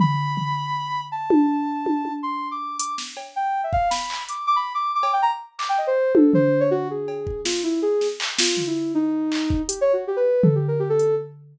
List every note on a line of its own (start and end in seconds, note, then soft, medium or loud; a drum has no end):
0.00 1.01 B5 loud
0.00 floor tom loud
0.37 floor tom medium
1.12 2.12 A5 medium
1.30 high tom loud
1.86 high tom medium
2.05 high tom soft
2.23 2.48 C6 medium
2.51 2.76 D6 medium
2.78 2.95 D6 medium
2.78 closed hi-hat loud
2.98 snare medium
3.17 cowbell medium
3.36 3.61 G5 medium
3.64 3.72 E5 medium
3.73 3.89 F5 loud
3.73 kick medium
3.90 4.24 B5 medium
3.90 snare medium
4.10 clap medium
4.29 4.46 D6 soft
4.29 closed hi-hat medium
4.47 4.55 D6 loud
4.56 4.73 B5 medium
4.74 4.91 D6 medium
4.95 5.12 D6 medium
5.03 cowbell medium
5.13 5.21 G5 medium
5.22 5.31 A#5 loud
5.59 5.67 D6 medium
5.59 clap medium
5.69 5.77 G5 loud
5.78 5.86 D#5 medium
5.87 6.12 C5 loud
6.15 6.32 A4 medium
6.15 high tom loud
6.34 6.59 C5 loud
6.34 floor tom medium
6.60 6.69 C#5 loud
6.71 6.88 F#4 loud
6.90 7.41 G#4 medium
7.08 cowbell medium
7.27 kick medium
7.45 7.62 F4 medium
7.45 snare medium
7.64 7.80 E4 medium
7.82 8.07 G#4 medium
8.01 snare soft
8.20 clap loud
8.39 8.64 F4 medium
8.39 snare loud
8.57 floor tom medium
8.67 8.92 E4 medium
8.95 9.62 D#4 loud
9.32 clap medium
9.50 kick loud
9.68 9.79 G4 medium
9.68 closed hi-hat loud
9.81 9.92 C#5 loud
9.93 10.04 F#4 medium
10.07 10.16 G4 medium
10.16 10.42 B4 medium
10.43 10.54 A4 medium
10.43 floor tom loud
10.55 10.66 G4 medium
10.68 10.79 A#4 medium
10.80 10.88 G4 medium
10.90 11.15 A4 loud
10.99 closed hi-hat medium